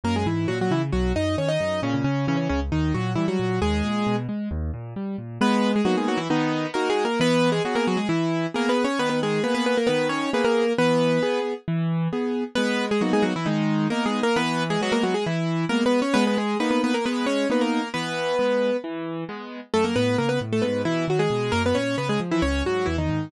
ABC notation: X:1
M:4/4
L:1/16
Q:1/4=134
K:G#m
V:1 name="Acoustic Grand Piano"
[A,A] [G,G] [E,E]2 [F,F] [F,F] [E,E] z [F,F]2 [Dd]2 [Cc] [Dd]3 | [C,C] [C,C] [C,C]2 [C,C] [C,C] [C,C] z [D,D]2 [F,F]2 [E,E] [F,F]3 | [G,G]6 z10 | [B,B]3 [G,G] [F,F] [G,G] [F,F] [E,E] [D,D]4 (3[A,A]2 [G,G]2 [A,A]2 |
[B,B]3 [G,G] [F,F] [A,A] [F,F] [G,G] [E,E]4 (3[A,A]2 [B,B]2 [Cc]2 | [B,B] [B,B] [G,G]2 [B,B] [B,B] [B,B] [A,A] [B,B]2 [Cc]2 [B,B] [A,A]3 | [B,B]6 z10 | [B,B]3 [G,G] [F,F] [G,G] [F,F] [E,E] [D,D]4 (3[A,A]2 [G,G]2 [A,A]2 |
[B,B]3 [G,G] [F,F] [A,A] [F,F] [G,G] [E,E]4 (3[A,A]2 [B,B]2 [Cc]2 | [B,B] [B,B] [G,G]2 [B,B] [B,B] [B,B] [A,A] [B,B]2 [Cc]2 [B,B] [A,A]3 | [B,B]8 z8 | [=A,=A] [^A,^A] [B,B]2 [A,A] [B,B] z [=A,=A] [B,B]2 [E,E]2 [F,F] [G,G]3 |
[A,A] [B,B] [Cc]2 [B,B] [G,G] z [E,E] [Cc]2 [F,F]2 [E,E] [D,D]3 |]
V:2 name="Acoustic Grand Piano"
F,,2 G,,2 A,,2 C,2 B,,,2 F,,2 D,2 F,,2 | A,,2 z2 E,2 C,,2 D,,2 A,,2 =G,2 A,,2 | D,,2 A,,2 B,,2 G,2 D,,2 A,,2 =G,2 A,,2 | G,4 [A,B,D]4 B,4 [DF]4 |
E,4 [B,G]4 z4 [B,G]4 | D,4 [A,G]4 D,4 [A,B,G]4 | E,4 [B,G]4 E,4 [B,G]4 | G,4 [A,B,D]4 G,4 [B,D]4 |
E,4 [G,B,]4 z4 [G,B,]4 | G,4 [A,D]4 G,4 [A,B,D]4 | E,4 [G,B,]4 E,4 [G,B,]4 | F,,2 =A,,2 C,2 A,,2 G,,2 B,,2 D,2 B,,2 |
F,,2 A,,2 C,2 ^E,2 C,,2 G,,2 =E,,2 G,,2 |]